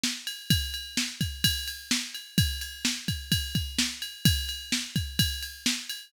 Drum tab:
RD |-x|xx-xxx-x|xx-xxx-x|xx-xxx-x|
SD |o-|--o---o-|--o---o-|--o---o-|
BD |--|o--oo---|o--ooo--|o--oo---|